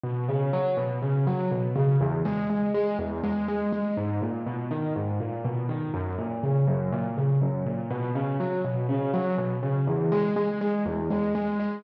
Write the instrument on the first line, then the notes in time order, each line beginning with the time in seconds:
acoustic grand piano
0.03 B2
0.28 C#3
0.53 F#3
0.77 B2
1.02 C#3
1.27 F#3
1.51 B2
1.76 C#3
2.01 E2
2.25 G#3
2.50 G#3
2.74 G#3
2.99 E2
3.23 G#3
3.48 G#3
3.72 G#3
3.97 G#2
4.22 A#2
4.46 B2
4.71 D#3
4.96 G#2
5.20 A#2
5.45 B2
5.69 D#3
5.94 F#2
6.18 A#2
6.43 C#3
6.67 F#2
6.92 A#2
7.17 C#3
7.41 F#2
7.66 A#2
7.90 B2
8.15 C#3
8.40 F#3
8.64 B2
8.89 C#3
9.14 F#3
9.38 B2
9.63 C#3
9.87 E2
10.12 G#3
10.36 G#3
10.61 G#3
10.86 E2
11.10 G#3
11.35 G#3
11.60 G#3